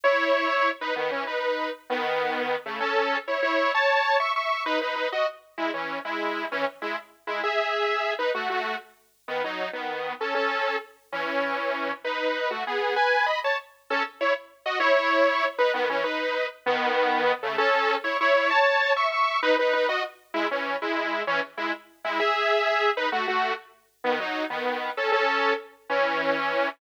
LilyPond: \new Staff { \time 6/8 \key fis \dorian \tempo 4. = 130 <e' cis''>2~ <e' cis''>8 <dis' b'>8 | <dis b>8 <e cis'>8 <dis' b'>4. r8 | <dis b>2~ <dis b>8 <cis a>8 | <cis' a'>4. <e' cis''>8 <e' cis''>4 |
<cis'' a''>4. <e'' cis'''>8 <e'' cis'''>4 | <dis' b'>8 <dis' b'>8 <dis' b'>8 <fis' dis''>8 r4 | <gis e'>8 <e cis'>4 <gis e'>4. | <e cis'>8 r8 <gis e'>8 r4 <gis e'>8 |
<gis' e''>2~ <gis' e''>8 <dis' b'>8 | <a fis'>8 <a fis'>4 r4. | <dis b>8 <fis dis'>4 <dis b>4. | <cis' a'>8 <cis' a'>4. r4 |
<e cis'>2. | <dis' b'>4. <a fis'>8 <b gis'>4 | <b' gis''>4 <dis'' b''>8 <cis'' a''>8 r4 | <cis' a'>8 r8 <e' cis''>8 r4 <fis' dis''>8 |
<e' cis''>2~ <e' cis''>8 <dis' b'>8 | <dis b>8 <e cis'>8 <dis' b'>4. r8 | <dis b>2~ <dis b>8 <cis a>8 | <cis' a'>4. <e' cis''>8 <e' cis''>4 |
<cis'' a''>4. <e'' cis'''>8 <e'' cis'''>4 | <dis' b'>8 <dis' b'>8 <dis' b'>8 <fis' dis''>8 r4 | <gis e'>8 <e cis'>4 <gis e'>4. | <e cis'>8 r8 <gis e'>8 r4 <gis e'>8 |
<gis' e''>2~ <gis' e''>8 <dis' b'>8 | <a fis'>8 <a fis'>4 r4. | <dis b>8 <fis dis'>4 <dis b>4. | <cis' a'>8 <cis' a'>4. r4 |
<e cis'>2. | }